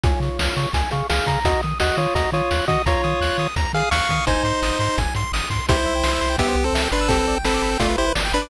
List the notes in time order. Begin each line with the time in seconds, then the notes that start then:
0.04 C#2 F4 C#5 G#5, kick, closed hi-hat
0.20 C#3 C#6, closed hi-hat
0.39 C#2 F6, snare
0.57 C#3 C#6, closed hi-hat
0.73 C#2 G#5, kick, closed hi-hat
0.91 C#3 G#4 F5 C#6, closed hi-hat
1.09 C#2 G#4 F5 F6, snare
1.27 C#3 A#5, kick, closed hi-hat
1.45 D#2 F#4 D#5, kick, closed hi-hat
1.63 D#3 D#6, closed hi-hat
1.80 D#2 F#4 D#5 F#6, snare
1.97 D#3 F4 C#5 D#6, closed hi-hat
2.15 D#2 F#4 D#5 A#5, kick, closed hi-hat
2.32 D#3 F4 C#5 D#6, closed hi-hat
2.51 D#2 F#6, snare
2.68 D#3 F#4 D#5 D#6, kick, closed hi-hat
2.86 D#2 F4 C#5 A#5, kick, closed hi-hat
3.04 D#3 D#6, closed hi-hat
3.21 D#2 F#6, snare
3.38 D#3 D#6, closed hi-hat
3.56 D#2 A#5, kick, closed hi-hat
3.73 D#3 G#4 F5 D#6, closed hi-hat
3.91 D#2 F5 C#6 F#6, snare
4.09 D#3 D#6, kick, closed hi-hat
4.27 G#1 D#4 C5 G#5, kick, closed hi-hat
4.43 G#2 C6, closed hi-hat
4.62 G#1 D#6, snare
4.79 G#2 C6, closed hi-hat
4.98 G#1 G#5, kick, closed hi-hat
5.15 G#2 C6, closed hi-hat
5.32 G#1 D#6, snare
5.50 G#2 C6, kick, closed hi-hat
5.69 C2 E4 G4 C5, kick, closed hi-hat
5.77 C5
5.86 C2 E5
5.95 G5
6.04 C2 C6, snare
6.13 E6
6.21 C2 C6, snare
6.30 G5
6.38 C2 B3 G4 E5, kick, closed hi-hat
6.48 C5
6.55 C2 G4
6.64 C4 A4 C5
6.73 C2 E5, snare
6.83 G5
6.91 G1 D4 B4 C6
7.01 E6
7.09 C4 G4 A4, kick, closed hi-hat
7.18 B4
7.28 G1 D5
7.36 G5
7.44 G1 C4 A4 B5, snare
7.54 D6
7.62 G1 B5, snare
7.72 G5
7.79 G1 A3 F4 D5, kick, closed hi-hat
7.90 B4
7.98 G1 E4 G4 C5
8.06 B4
8.15 G1 D5, snare
8.25 G5
8.32 G1 D4 B4 B5
8.42 D6